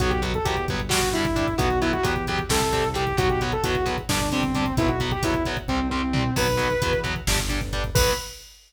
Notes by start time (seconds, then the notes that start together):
0.00 B1 F#3 B3 F#4, kick, closed hi-hat
0.10 G4, kick
0.22 F#3 B3, kick, closed hi-hat
0.34 A4, kick
0.45 E2 F#3 B3 G4, kick, closed hi-hat
0.57 kick
0.68 G1 F#3 B3, kick, closed hi-hat
0.80 kick
0.89 G3 D4 F#4, kick, snare
1.02 kick
1.13 G3 D4 E4, kick, closed hi-hat
1.25 kick
1.36 G3 D4, kick, closed hi-hat
1.48 kick
1.58 B1 F#3 B3 F#4, kick, closed hi-hat
1.70 kick
1.82 F#3 B3 E4, kick, closed hi-hat
1.93 F#4, kick
2.03 E2 F#3 B3 G4, kick, closed hi-hat
2.16 kick
2.27 F#3 B3 G4, kick, closed hi-hat
2.39 kick
2.49 C2 G3 C4 A4, kick, snare
2.61 kick
2.73 G3 C4, kick, closed hi-hat
2.84 kick
2.94 G3 C4 G4, kick, closed hi-hat
3.07 kick
3.17 B1 F#3 B3 F#4, kick, closed hi-hat
3.29 G4, kick
3.41 F#3 B3, kick, closed hi-hat
3.52 A4, kick
3.64 E2 F#3 B3 F#4, kick, closed hi-hat
3.75 kick
3.86 F#3 B3, kick, closed hi-hat
3.98 kick
4.09 G1 G3 D4, kick, snare
4.20 kick
4.32 G3 C4 D4, kick, closed hi-hat
4.43 kick
4.55 G3 D4, kick, closed hi-hat
4.66 kick
4.77 B1 F#3 B3 E4, kick, closed hi-hat
4.89 F#4, kick
5.00 F#3 B3, kick, closed hi-hat
5.11 G4, kick
5.23 E2 F#3 B3 E4, kick, closed hi-hat
5.34 kick
5.45 F#3 B3, kick, closed hi-hat
5.57 kick
5.68 C2 G3 C4, kick
5.90 G3 C4, floor tom
6.13 G3 C4, mid tom
6.36 B1 F#3 B3 B4, kick, crash
6.48 kick
6.57 F#3 B3, kick, closed hi-hat
6.70 kick
6.82 E2 F#3 B3, kick, closed hi-hat
6.93 kick
7.04 F#3 B3, kick, closed hi-hat
7.16 kick
7.27 G1 G3 D4, kick, snare
7.39 kick
7.49 G3 D4, kick, closed hi-hat
7.61 kick
7.73 G3 D4, kick, closed hi-hat
7.84 kick
7.95 B1 F#3 B3 B4, kick, crash